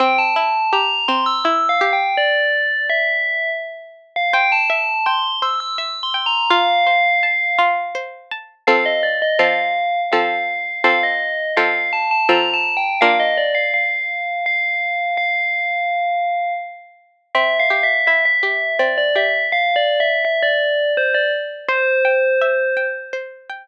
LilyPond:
<<
  \new Staff \with { instrumentName = "Tubular Bells" } { \time 3/4 \key c \mixolydian \tempo 4 = 83 g''16 a''8. bes''8 c'''16 e'''16 \tuplet 3/2 { e'''8 f''8 g''8 } | d''4 e''4 r8. f''16 | g''16 a''8. c'''8 e'''16 e'''16 \tuplet 3/2 { e'''8 c'''8 bes''8 } | f''2 r4 |
\key f \mixolydian f''16 ees''16 d''16 ees''16 f''4 f''4 | f''16 ees''8. f''8 a''16 a''16 \tuplet 3/2 { bes''8 a''8 g''8 } | f''16 ees''16 d''16 f''16 f''4 f''4 | f''2 r4 |
\key c \mixolydian \tuplet 3/2 { e''8 f''8 e''8 } e''16 e''8. d''16 d''16 e''8 | \tuplet 3/2 { f''8 d''8 e''8 } e''16 d''8. c''16 d''16 r8 | c''2 r4 | }
  \new Staff \with { instrumentName = "Harpsichord" } { \time 3/4 \key c \mixolydian c'8 e'8 g'8 c'8 e'8 g'8 | r2. | c''8 e''8 g''8 c''8 e''8 g''8 | f'8 c''8 a''8 f'8 c''8 a''8 |
\key f \mixolydian <f c' a'>4 <f c' a'>4 <f c' a'>4 | <f c' a'>4 <f c' a'>4 <f c' a'>4 | <bes d' f'>2.~ | <bes d' f'>2. |
\key c \mixolydian c'8 g'8 e'8 g'8 c'8 g'8 | r2. | c''8 g''8 e''8 g''8 c''8 g''8 | }
>>